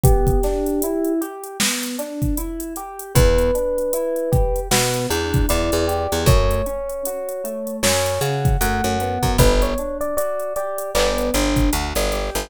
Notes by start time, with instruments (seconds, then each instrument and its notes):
0.03 electric piano 1 B3 G4, kick, closed hi-hat
0.27 kick, closed hi-hat
0.43 electric piano 1 D4, snare, closed hi-hat
0.66 closed hi-hat
0.82 electric piano 1 E4, closed hi-hat
1.05 closed hi-hat
1.21 electric piano 1 G4, closed hi-hat
1.44 closed hi-hat
1.60 electric piano 1 B3, snare
1.83 closed hi-hat
1.99 electric piano 1 D4, closed hi-hat
2.22 kick, closed hi-hat
2.37 electric piano 1 E4, closed hi-hat
2.60 closed hi-hat
2.76 electric piano 1 G4, closed hi-hat
2.99 closed hi-hat
3.15 electric bass (finger) E2, electric piano 1 B3 B4, kick, closed hi-hat
3.38 closed hi-hat
3.55 electric piano 1 D4, closed hi-hat
3.78 closed hi-hat
3.93 electric piano 1 E4, closed hi-hat
4.16 closed hi-hat
4.32 electric piano 1 G4, kick, closed hi-hat
4.56 closed hi-hat
4.71 electric bass (finger) B2, electric piano 1 B3 B4, snare
4.94 closed hi-hat
5.10 electric bass (finger) E2, electric piano 1 D4, closed hi-hat
5.34 kick, closed hi-hat
5.49 electric bass (finger) E2, electric piano 1 E4 D5, closed hi-hat
5.72 electric bass (finger) E2, closed hi-hat
5.87 electric piano 1 G4, closed hi-hat
6.12 electric bass (finger) E2, closed hi-hat
6.26 electric bass (finger) F#2, electric piano 1 A3 C#5, kick, closed hi-hat
6.51 closed hi-hat
6.66 electric piano 1 C#4, closed hi-hat
6.89 closed hi-hat
7.05 electric piano 1 F#4, closed hi-hat
7.29 closed hi-hat
7.44 electric piano 1 A3, closed hi-hat
7.67 closed hi-hat
7.83 electric bass (finger) F#2, electric piano 1 C#4 C#5, snare
8.06 closed hi-hat
8.21 electric bass (finger) C#3, electric piano 1 F#4, closed hi-hat
8.45 kick, closed hi-hat
8.61 electric bass (finger) F#2, electric piano 1 A3 F#5, closed hi-hat
8.84 electric bass (finger) F#2, closed hi-hat
9.00 electric piano 1 B3, closed hi-hat
9.23 electric bass (finger) F#2, kick, closed hi-hat
9.38 electric bass (finger) G1, electric piano 1 B4, kick, closed hi-hat
9.62 electric piano 1 C#5, closed hi-hat
9.78 electric piano 1 D4, closed hi-hat
10.01 electric piano 1 D5, closed hi-hat
10.17 electric piano 1 F#4 D5, closed hi-hat
10.39 closed hi-hat
10.56 electric piano 1 G4 D5, closed hi-hat
10.78 closed hi-hat
10.95 electric bass (finger) G1, electric piano 1 B3 D5, clap
11.18 closed hi-hat
11.34 electric bass (finger) G1, electric piano 1 D4, closed hi-hat
11.56 kick, closed hi-hat
11.73 electric bass (finger) D2, electric piano 1 F#4, closed hi-hat
11.95 electric bass (finger) G1, closed hi-hat
12.12 electric piano 1 G4, snare, closed hi-hat
12.35 electric bass (finger) G1, closed hi-hat